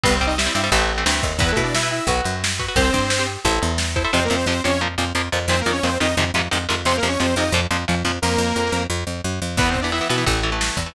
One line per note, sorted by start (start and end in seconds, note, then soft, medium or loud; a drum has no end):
0.03 0.49 C2 loud
0.03 0.18 G3 medium
0.03 0.15 B3 medium
0.03 0.18 C4 medium
0.03 0.15 B4 medium
0.03 kick medium
0.03 ride medium
0.15 0.26 C4 medium
0.15 0.26 C5 medium
0.21 0.35 G3 medium
0.21 0.35 C4 medium
0.21 kick medium
0.21 ride soft
0.27 0.37 D#4 medium
0.27 0.37 D#5 medium
0.38 0.45 G3 medium
0.38 0.45 C4 medium
0.38 0.54 E4 medium
0.38 0.54 E5 medium
0.38 snare medium
0.46 0.53 G3 medium
0.46 0.53 C4 medium
0.54 0.70 G2 medium
0.54 0.62 G3 medium
0.54 0.62 C4 medium
0.54 0.70 E4 medium
0.54 0.70 E5 medium
0.54 ride medium
0.64 0.70 G3 medium
0.64 0.70 C4 medium
0.71 1.04 A1 loud
0.71 0.92 E3 medium
0.71 0.92 A3 medium
0.71 0.92 C4 medium
0.71 kick medium
0.71 ride medium
0.90 ride medium
0.98 1.05 E3 medium
0.98 1.05 A3 medium
0.98 1.05 C4 medium
1.06 1.21 D2 medium
1.06 1.33 E3 medium
1.06 1.33 A3 medium
1.06 1.33 C4 medium
1.06 snare medium
1.23 1.39 D#2 medium
1.23 kick medium
1.23 ride medium
1.39 1.53 E2 medium
1.39 1.51 B3 medium
1.39 1.47 E4 loud
1.39 1.47 B4 medium
1.39 1.51 B4 medium
1.39 kick medium
1.39 ride medium
1.49 1.62 A3 medium
1.49 1.55 E4 medium
1.49 1.62 A4 medium
1.49 1.55 B4 medium
1.56 2.00 B2 medium
1.56 1.78 E4 medium
1.56 1.78 B4 medium
1.56 kick medium
1.56 ride medium
1.63 1.74 D4 medium
1.63 1.74 D5 medium
1.74 1.88 E4 medium
1.74 1.88 E5 medium
1.74 snare medium
1.83 2.03 E4 medium
1.83 2.03 B4 medium
1.91 2.06 E4 medium
1.91 2.06 E5 medium
1.91 ride medium
2.07 2.21 B1 medium
2.07 2.36 F#4 medium
2.07 2.36 B4 loud
2.07 kick medium
2.07 ride medium
2.24 2.69 F#2 medium
2.24 ride medium
2.44 snare medium
2.59 2.66 F#4 medium
2.59 2.66 B4 medium
2.59 kick medium
2.59 ride medium
2.68 2.75 F#4 medium
2.68 2.75 B4 medium
2.76 2.90 C2 medium
2.76 3.26 C4 medium
2.76 2.83 G4 medium
2.76 2.83 C5 medium
2.76 3.26 C5 loud
2.76 kick medium
2.76 ride medium
2.85 2.92 G4 medium
2.85 2.92 C5 medium
2.93 3.37 G2 medium
2.93 3.14 G4 medium
2.93 3.14 C5 medium
2.93 kick medium
2.93 ride medium
3.10 snare medium
3.19 3.40 G4 medium
3.19 3.40 C5 medium
3.27 ride medium
3.45 3.59 A1 loud
3.45 3.72 E4 medium
3.45 3.72 A4 medium
3.45 3.72 C5 medium
3.45 kick medium
3.45 ride medium
3.62 4.06 E2 medium
3.62 ride medium
3.78 snare medium
3.96 4.03 E4 medium
3.96 4.03 A4 medium
3.96 4.03 C5 medium
3.96 kick medium
3.96 ride medium
4.04 4.11 E4 medium
4.04 4.11 A4 medium
4.04 4.11 C5 medium
4.13 4.28 F2 medium
4.13 4.20 C3 medium
4.13 4.20 F3 medium
4.13 4.24 C4 medium
4.13 4.24 C5 loud
4.24 4.35 A#3 medium
4.24 4.35 A#4 medium
4.30 4.45 F2 medium
4.30 4.37 C3 medium
4.30 4.37 F3 medium
4.36 4.46 C4 medium
4.36 4.46 C5 medium
4.46 4.61 F2 medium
4.46 4.54 C3 medium
4.46 4.54 F3 medium
4.46 4.63 C4 medium
4.46 4.63 C5 medium
4.64 4.97 F2 medium
4.64 4.71 C3 medium
4.64 4.71 F3 medium
4.64 4.81 C#4 medium
4.64 4.81 C#5 medium
4.81 4.88 A#2 medium
4.81 4.88 F3 medium
4.98 5.13 F2 medium
4.98 5.05 A#2 medium
4.98 5.05 F3 medium
5.15 5.29 F2 medium
5.15 5.22 A#2 medium
5.15 5.22 F3 medium
5.32 5.47 F2 medium
5.32 5.39 A#2 medium
5.32 5.39 F3 medium
5.48 5.62 F2 medium
5.48 5.56 A#2 medium
5.48 5.56 D#3 medium
5.48 5.60 C4 medium
5.48 5.60 C5 loud
5.61 5.71 A#3 medium
5.61 5.71 A#4 medium
5.66 5.81 F2 medium
5.66 5.73 A#2 medium
5.66 5.73 D#3 medium
5.72 5.83 C#4 medium
5.72 5.83 C#5 medium
5.83 5.98 F2 medium
5.83 5.90 A#2 medium
5.83 5.90 D#3 medium
5.83 5.98 C4 medium
5.83 5.98 C5 medium
6.00 6.15 F2 medium
6.00 6.07 A#2 medium
6.00 6.07 D#3 medium
6.00 6.16 D#4 medium
6.00 6.16 D#5 medium
6.17 6.32 F2 medium
6.17 6.24 G#2 medium
6.17 6.24 C3 medium
6.17 6.24 D#3 medium
6.34 6.48 F2 medium
6.34 6.42 G#2 medium
6.34 6.42 C3 medium
6.34 6.42 D#3 medium
6.51 6.67 F2 medium
6.51 6.58 G#2 medium
6.51 6.58 C3 medium
6.51 6.58 D#3 medium
6.69 6.84 F2 medium
6.69 6.75 G#2 medium
6.69 6.75 C3 medium
6.69 6.75 D#3 medium
6.85 7.00 F2 medium
6.85 6.93 C3 medium
6.85 6.93 F3 medium
6.85 6.96 C4 loud
6.85 6.96 C5 loud
6.97 7.08 A#3 medium
6.97 7.08 A#4 medium
7.03 7.17 F2 medium
7.03 7.10 C3 medium
7.03 7.10 F3 medium
7.08 7.19 C#4 medium
7.08 7.19 C#5 medium
7.20 7.35 F2 medium
7.20 7.26 C3 medium
7.20 7.26 F3 medium
7.20 7.35 C4 medium
7.20 7.35 C5 medium
7.36 7.51 F2 medium
7.36 7.44 C3 medium
7.36 7.44 F3 medium
7.36 7.52 D#4 medium
7.36 7.52 D#5 medium
7.52 7.67 F2 medium
7.52 7.61 A#2 medium
7.52 7.61 F3 medium
7.71 7.85 F2 medium
7.71 7.77 A#2 medium
7.71 7.77 F3 medium
7.88 8.03 F2 medium
7.88 7.95 A#2 medium
7.88 7.95 F3 medium
8.05 8.19 F2 medium
8.05 8.12 A#2 medium
8.05 8.12 F3 medium
8.22 8.37 F2 loud
8.22 8.83 A#3 loud
8.22 8.83 A#4 loud
8.38 8.53 F2 medium
8.56 8.70 F2 medium
8.72 8.87 F2 medium
8.90 9.04 F2 medium
9.07 9.21 F2 medium
9.24 9.40 F#2 medium
9.42 9.57 F2 medium
9.57 10.01 E2 medium
9.57 9.79 E3 medium
9.57 9.69 B3 medium
9.57 9.79 B3 medium
9.57 9.69 B4 medium
9.57 kick medium
9.57 crash medium
9.70 9.81 C4 medium
9.70 9.81 C5 medium
9.74 kick medium
9.74 ride medium
9.81 9.91 E3 medium
9.81 9.91 B3 medium
9.81 9.92 D4 medium
9.81 9.92 D5 medium
9.92 9.99 E3 medium
9.92 9.99 B3 medium
9.92 10.08 E4 medium
9.92 10.08 E5 medium
9.92 ride medium
10.01 10.08 E3 medium
10.01 10.08 B3 medium
10.09 10.25 B2 medium
10.09 10.16 E3 medium
10.09 10.16 B3 medium
10.09 10.25 E4 medium
10.09 10.25 E5 medium
10.09 ride medium
10.18 10.25 E3 medium
10.18 10.25 B3 medium
10.26 10.70 A1 medium
10.26 10.40 E3 medium
10.26 10.40 A3 medium
10.26 kick medium
10.26 ride medium
10.43 10.50 E3 medium
10.43 10.50 A3 medium
10.43 ride soft
10.52 10.79 E3 medium
10.52 10.79 A3 medium
10.61 snare medium
10.77 10.91 E2 medium
10.77 kick medium
10.77 ride medium
10.86 10.93 E3 medium
10.86 10.93 A3 medium